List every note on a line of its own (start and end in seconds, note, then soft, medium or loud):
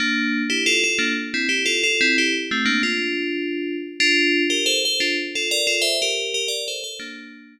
0.00 0.42 A#3 medium
0.00 0.42 D4 medium
0.50 0.63 E4 medium
0.50 0.63 G4 medium
0.66 0.82 F4 medium
0.66 0.82 A4 loud
0.84 0.99 F4 medium
0.84 0.99 A4 medium
0.99 1.13 A#3 medium
0.99 1.13 D4 medium
1.34 1.47 C4 medium
1.34 1.47 E4 medium
1.49 1.63 E4 medium
1.49 1.63 G4 medium
1.66 1.82 F4 medium
1.66 1.82 A4 medium
1.83 2.00 F4 medium
1.83 2.00 A4 medium
2.01 2.16 C4 medium
2.01 2.16 E4 loud
2.18 2.34 E4 medium
2.18 2.34 G4 medium
2.51 2.65 A3 medium
2.51 2.65 C4 medium
2.65 2.81 A#3 medium
2.65 2.81 D4 medium
2.83 3.75 D4 medium
2.83 3.75 F4 medium
4.00 4.43 D4 loud
4.00 4.43 F4 loud
4.50 4.64 G4 medium
4.50 4.64 A#4 medium
4.66 4.80 A4 medium
4.66 4.80 C5 medium
4.85 5.00 A4 medium
4.85 5.00 C5 medium
5.00 5.16 D4 medium
5.00 5.16 F4 medium
5.35 5.49 F4 medium
5.35 5.49 A4 medium
5.51 5.65 A#4 medium
5.51 5.65 D5 medium
5.67 5.82 F4 medium
5.67 5.82 A4 medium
5.82 5.97 C5 medium
5.82 5.97 E5 medium
6.02 6.33 G4 medium
6.02 6.33 A#4 medium
6.34 6.48 G4 medium
6.34 6.48 A#4 medium
6.48 6.64 A#4 medium
6.48 6.64 D5 medium
6.68 6.82 A4 medium
6.68 6.82 C5 medium
6.84 6.97 A4 medium
6.84 6.97 C5 medium
7.00 7.54 A#3 medium
7.00 7.54 D4 medium